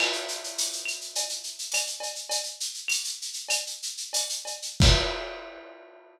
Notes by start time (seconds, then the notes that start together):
0.00 crash, cowbell, claves
0.13 shaker
0.28 shaker
0.44 shaker
0.58 tambourine, shaker
0.73 shaker
0.85 claves, shaker
1.01 shaker
1.15 cowbell, shaker
1.29 shaker
1.44 shaker
1.59 shaker
1.72 tambourine, cowbell, claves, shaker
1.87 shaker
2.00 cowbell, shaker
2.15 shaker
2.29 cowbell, shaker
2.43 shaker
2.60 shaker
2.74 shaker
2.88 tambourine, claves, shaker
3.04 shaker
3.22 shaker
3.33 shaker
3.49 cowbell, claves, shaker
3.67 shaker
3.82 shaker
3.97 shaker
4.13 tambourine, cowbell, shaker
4.29 shaker
4.45 cowbell, shaker
4.62 shaker
4.80 kick, crash